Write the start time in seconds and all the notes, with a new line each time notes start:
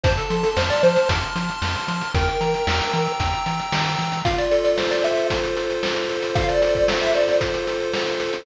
0.04 F2 C5 A5, kick, closed hi-hat
0.17 A4, closed hi-hat
0.30 F3 C6, closed hi-hat
0.43 A4, closed hi-hat
0.57 F2 C5 F6, snare
0.70 D5, closed hi-hat
0.83 F3 C5 C6, closed hi-hat
0.96 closed hi-hat
1.09 F2 A5, kick, closed hi-hat
1.22 closed hi-hat
1.36 F3 C6, closed hi-hat
1.49 closed hi-hat
1.62 F2 F6, snare
1.75 closed hi-hat
1.88 F3 C6, closed hi-hat
2.01 closed hi-hat
2.14 E2 A#4 G5, kick, closed hi-hat
2.28 closed hi-hat
2.41 E3 A#5, closed hi-hat
2.54 closed hi-hat
2.67 E2 E6, snare
2.80 closed hi-hat
2.93 E3 A#5, closed hi-hat
3.07 closed hi-hat
3.20 E2 G5, kick, closed hi-hat
3.33 closed hi-hat
3.46 E3 A#5, closed hi-hat
3.59 closed hi-hat
3.72 D#3 E6, snare
3.86 closed hi-hat
3.99 E3 A#5, closed hi-hat
4.12 closed hi-hat
4.25 F4 F5, kick, closed hi-hat
4.38 D5, closed hi-hat
4.51 A4, closed hi-hat
4.64 D5, closed hi-hat
4.78 C5, snare
4.91 D5, closed hi-hat
5.04 A4 E5, closed hi-hat
5.17 closed hi-hat
5.30 F4, kick, closed hi-hat
5.43 closed hi-hat
5.57 A4, closed hi-hat
5.70 closed hi-hat
5.83 C5, snare
5.96 closed hi-hat
6.09 A4, closed hi-hat
6.22 closed hi-hat
6.35 F4 F5, kick, closed hi-hat
6.49 D5, closed hi-hat
6.62 A4, closed hi-hat
6.75 D5, kick, closed hi-hat
6.88 C5, snare
7.01 E5, closed hi-hat
7.14 A4 D5, closed hi-hat
7.28 closed hi-hat
7.41 F4, kick, closed hi-hat
7.54 closed hi-hat
7.67 A4, closed hi-hat
7.80 closed hi-hat
7.93 C5, snare
8.07 closed hi-hat
8.20 A4, closed hi-hat
8.33 closed hi-hat